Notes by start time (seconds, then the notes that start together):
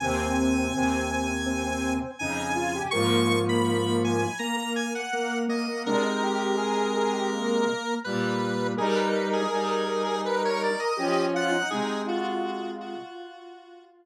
0.00 D#2 C3 C4 G#5
0.73 D#2 C3
1.46 C4
1.64 C4
2.19 F2 C#3 D#4 G#5
2.55 F4
2.75 G4
2.91 G#2 F3 A#3 C#6
3.49 B5
4.04 G#5
4.39 A#3 A#5
4.57 A#3
4.76 G#5
4.95 F#5
5.13 A#3
5.48 A#3 D#5
5.68 A#3
5.85 C3 G#3 D4 A#4
6.03 D#4
6.23 G4
6.57 G#4
6.97 G#4
7.13 G4
7.32 A#3
8.04 A#2 G3 B4
8.77 G3 D#4 G#4 A#4
8.96 B4
9.33 G#4
9.51 G3 D#4
10.04 G#4
10.25 A#4 B4
10.42 A#4 C#5
10.63 D5
10.79 D#5
10.97 F3 C#4 G4
11.34 F4 F#5
11.52 D#4
11.70 C3 G#3 D#4 G#4
12.07 F4 F#4
12.81 F#4